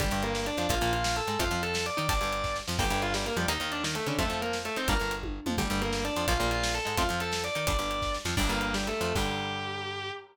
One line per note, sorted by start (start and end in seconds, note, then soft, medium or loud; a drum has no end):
0.00 0.10 G1 loud
0.00 0.05 D3 medium
0.00 0.05 G3 medium
0.00 0.20 G3 loud
0.00 0.20 G4 loud
0.00 kick loud
0.00 closed hi-hat loud
0.11 0.50 G1 loud
0.11 0.52 G2 loud
0.11 closed hi-hat medium
0.23 0.43 A#3 loud
0.23 0.43 A#4 loud
0.23 closed hi-hat medium
0.35 snare loud
0.46 0.66 D4 medium
0.46 0.66 D5 loud
0.46 closed hi-hat medium
0.57 0.67 F2 medium
0.57 0.68 F3 medium
0.57 closed hi-hat medium
0.69 0.79 A#1 loud
0.69 0.75 F3 medium
0.69 0.75 A#3 loud
0.69 0.90 F4 loud
0.69 0.90 F5 loud
0.69 kick loud
0.69 closed hi-hat loud
0.81 1.21 A#1 loud
0.81 1.21 A#2 loud
0.81 closed hi-hat medium
0.93 1.13 F4 medium
0.93 1.13 F5 medium
0.93 closed hi-hat medium
1.04 snare loud
1.16 1.38 A4 medium
1.16 1.38 A5 medium
1.16 closed hi-hat medium
1.27 1.37 G#2 medium
1.27 1.38 G#3 medium
1.27 closed hi-hat medium
1.39 1.49 F2 loud
1.39 1.44 F3 loud
1.39 1.44 A3 loud
1.39 1.44 C4 loud
1.39 1.59 F4 medium
1.39 1.59 F5 medium
1.39 kick loud
1.39 closed hi-hat loud
1.51 1.90 F2 loud
1.51 1.91 F3 medium
1.51 closed hi-hat medium
1.63 1.84 A4 medium
1.63 1.84 A5 medium
1.63 closed hi-hat medium
1.74 snare loud
1.74 closed hi-hat medium
1.86 2.07 D5 medium
1.86 2.07 D6 medium
1.86 closed hi-hat medium
1.97 2.08 D#3 loud
1.97 2.07 D#4 medium
1.97 closed hi-hat medium
2.09 2.20 G1 loud
2.09 2.14 G3 medium
2.09 2.14 D4 medium
2.09 2.52 D5 loud
2.09 2.52 D6 loud
2.09 kick loud
2.09 closed hi-hat loud
2.21 2.62 G1 medium
2.21 2.61 G2 medium
2.21 closed hi-hat medium
2.33 closed hi-hat medium
2.44 kick medium
2.44 snare medium
2.56 snare medium
2.68 2.79 F2 loud
2.68 2.77 F3 loud
2.68 snare loud
2.79 2.89 G1 loud
2.79 2.83 G3 loud
2.79 2.83 A#3 loud
2.79 2.83 D4 medium
2.79 2.99 G4 loud
2.79 2.99 G5 loud
2.79 kick loud
2.79 crash loud
2.90 3.30 G1 loud
2.90 3.30 G2 loud
2.90 closed hi-hat medium
3.02 3.14 F4 medium
3.02 3.14 F5 medium
3.02 closed hi-hat medium
3.14 3.25 G3 medium
3.14 3.25 G4 medium
3.14 snare loud
3.26 3.36 A#3 medium
3.26 3.36 A#4 loud
3.26 closed hi-hat medium
3.36 3.46 F2 loud
3.36 3.47 F3 medium
3.36 3.47 G3 medium
3.36 3.47 G4 medium
3.36 closed hi-hat medium
3.48 3.58 D#2 loud
3.48 3.53 A#3 medium
3.48 3.53 D#4 loud
3.48 3.68 D#4 medium
3.48 3.68 D#5 loud
3.48 closed hi-hat loud
3.60 4.00 D#2 loud
3.60 4.00 D#3 medium
3.60 closed hi-hat medium
3.72 3.82 D4 medium
3.72 3.82 D5 loud
3.72 closed hi-hat medium
3.84 3.94 D#3 medium
3.84 3.94 D#4 loud
3.84 snare loud
3.95 4.05 A3 medium
3.95 4.05 A4 medium
3.95 closed hi-hat medium
4.07 4.16 C#3 loud
4.07 4.18 D3 medium
4.07 4.17 C#4 medium
4.07 4.18 D4 loud
4.07 closed hi-hat medium
4.19 4.29 F2 loud
4.19 4.23 F3 loud
4.19 4.23 A3 loud
4.19 4.37 A3 loud
4.19 4.23 C4 loud
4.19 4.37 A4 loud
4.19 kick loud
4.19 closed hi-hat loud
4.29 4.69 F2 medium
4.29 4.70 F3 medium
4.29 closed hi-hat medium
4.42 4.53 A#3 medium
4.42 4.53 A#4 medium
4.42 closed hi-hat medium
4.53 snare loud
4.65 4.76 A3 medium
4.65 4.76 A4 loud
4.65 closed hi-hat medium
4.76 4.87 D#3 medium
4.76 4.88 C4 medium
4.76 4.87 D#4 medium
4.76 4.88 C5 medium
4.76 closed hi-hat medium
4.88 4.98 G1 loud
4.88 4.94 G3 loud
4.88 4.94 A#3 loud
4.88 4.94 D4 loud
4.88 5.10 A#4 medium
4.88 5.10 A#5 loud
4.88 kick loud
4.88 closed hi-hat loud
5.00 5.40 G1 medium
5.00 5.41 G2 medium
5.00 closed hi-hat medium
5.11 closed hi-hat medium
5.23 kick medium
5.23 high tom medium
5.46 5.56 F2 medium
5.46 5.57 F3 medium
5.46 mid tom loud
5.58 5.68 G1 loud
5.58 5.63 D3 medium
5.58 5.63 G3 medium
5.58 5.78 G3 loud
5.58 5.78 G4 loud
5.58 kick loud
5.58 closed hi-hat loud
5.70 6.10 G1 loud
5.70 6.10 G2 loud
5.70 closed hi-hat medium
5.81 6.01 A#3 loud
5.81 6.01 A#4 loud
5.81 closed hi-hat medium
5.93 snare loud
6.05 6.24 D4 medium
6.05 6.24 D5 loud
6.05 closed hi-hat medium
6.16 6.26 F2 medium
6.16 6.26 F3 medium
6.16 closed hi-hat medium
6.28 6.38 A#1 loud
6.28 6.33 F3 medium
6.28 6.33 A#3 loud
6.28 6.48 F4 loud
6.28 6.48 F5 loud
6.28 kick loud
6.28 closed hi-hat loud
6.40 6.80 A#1 loud
6.40 6.79 A#2 loud
6.40 closed hi-hat medium
6.51 6.71 F4 medium
6.51 6.71 F5 medium
6.51 closed hi-hat medium
6.63 snare loud
6.74 6.96 A4 medium
6.74 6.96 A5 medium
6.74 closed hi-hat medium
6.85 6.96 G#2 medium
6.85 6.95 G#3 medium
6.85 closed hi-hat medium
6.97 7.08 F2 loud
6.97 7.03 F3 loud
6.97 7.03 A3 loud
6.97 7.03 C4 loud
6.97 7.17 F4 medium
6.97 7.17 F5 medium
6.97 kick loud
6.97 closed hi-hat loud
7.09 7.49 F2 loud
7.09 7.49 F3 medium
7.09 closed hi-hat medium
7.20 7.43 A4 medium
7.20 7.43 A5 medium
7.20 closed hi-hat medium
7.32 snare loud
7.32 closed hi-hat medium
7.44 7.65 D5 medium
7.44 7.65 D6 medium
7.44 closed hi-hat medium
7.55 7.66 D#3 loud
7.55 7.66 D#4 medium
7.55 closed hi-hat medium
7.67 7.77 G1 loud
7.67 7.72 G3 medium
7.67 7.72 D4 medium
7.67 8.10 D5 loud
7.67 8.10 D6 loud
7.67 kick loud
7.67 closed hi-hat loud
7.79 8.18 G1 medium
7.79 8.18 G2 medium
7.79 closed hi-hat medium
7.91 closed hi-hat medium
8.02 kick medium
8.02 snare medium
8.14 snare medium
8.25 8.35 F2 loud
8.25 8.35 F3 loud
8.25 snare loud
8.37 8.48 G1 loud
8.37 8.42 G3 medium
8.37 8.42 D4 loud
8.37 8.48 D4 loud
8.37 8.48 D5 loud
8.37 kick loud
8.37 crash loud
8.49 8.93 G1 loud
8.49 8.93 G2 medium
8.49 8.73 A#3 medium
8.49 8.73 A#4 medium
8.49 closed hi-hat medium
8.61 closed hi-hat medium
8.74 8.87 G3 medium
8.74 8.87 G4 loud
8.74 snare loud
8.87 9.00 A3 medium
8.87 9.00 A4 loud
8.87 closed hi-hat medium
9.01 9.13 F2 loud
9.01 9.13 F3 medium
9.01 9.14 A3 medium
9.01 9.14 A4 medium
9.01 closed hi-hat medium
9.15 10.11 G2 loud
9.15 10.11 D3 medium
9.15 10.11 G3 loud
9.15 10.11 G4 loud
9.15 kick loud
9.15 crash loud